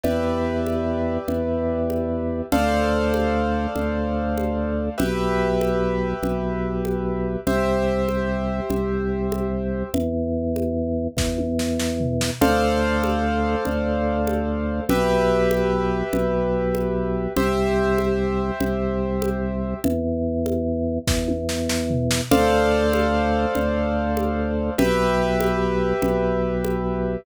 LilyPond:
<<
  \new Staff \with { instrumentName = "Acoustic Grand Piano" } { \time 12/8 \key d \dorian \tempo 4. = 97 <g' b' d'' e''>1. | <a' c'' d'' f''>1. | <g' b' e''>1. | <g' c'' e''>1. |
r1. | <a' c'' d'' f''>1. | <g' b' e''>1. | <g' c'' e''>1. |
r1. | <a' c'' d'' f''>1. | <g' b' e''>1. | }
  \new Staff \with { instrumentName = "Drawbar Organ" } { \clef bass \time 12/8 \key d \dorian e,2. e,2. | d,2. d,2. | b,,2. b,,2. | c,2. c,2. |
e,2. e,2. | d,2. d,2. | b,,2. b,,2. | c,2. c,2. |
e,2. e,2. | d,2. d,2. | b,,2. b,,2. | }
  \new DrumStaff \with { instrumentName = "Drums" } \drummode { \time 12/8 cgl4. cgho4. cgl4. cgho4. | cgl4. cgho4. cgl4. cgho4. | cgl4. cgho4. cgl4. cgho4. | cgl4. cgho4. cgl4. cgho4. |
cgl4. cgho4. <bd sn>8 tommh8 sn8 sn8 tomfh8 sn8 | cgl4. cgho4. cgl4. cgho4. | cgl4. cgho4. cgl4. cgho4. | cgl4. cgho4. cgl4. cgho4. |
cgl4. cgho4. <bd sn>8 tommh8 sn8 sn8 tomfh8 sn8 | cgl4. cgho4. cgl4. cgho4. | cgl4. cgho4. cgl4. cgho4. | }
>>